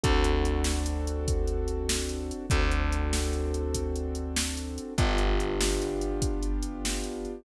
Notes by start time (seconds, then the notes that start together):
0.04 D2 C4 D4 F#4 A4, kick, closed hi-hat
0.24 closed hi-hat
0.45 closed hi-hat
0.64 snare
0.86 closed hi-hat
1.07 closed hi-hat
1.28 kick, closed hi-hat
1.47 closed hi-hat
1.68 closed hi-hat
1.89 snare
2.09 closed hi-hat
2.31 closed hi-hat
2.50 D2 C4 D4 F#4 A4, kick, closed hi-hat
2.71 closed hi-hat
2.92 closed hi-hat
3.13 snare
3.33 closed hi-hat
3.54 closed hi-hat
3.74 kick, closed hi-hat
3.96 closed hi-hat
4.15 closed hi-hat
4.36 snare
4.57 closed hi-hat
4.78 closed hi-hat
4.98 G1 B3 D4 F4 G4, kick, closed hi-hat
5.18 closed hi-hat
5.40 closed hi-hat
5.61 snare
5.82 closed hi-hat
6.01 closed hi-hat
6.22 kick, closed hi-hat
6.43 closed hi-hat
6.62 closed hi-hat
6.85 snare
7.04 closed hi-hat
7.25 closed hi-hat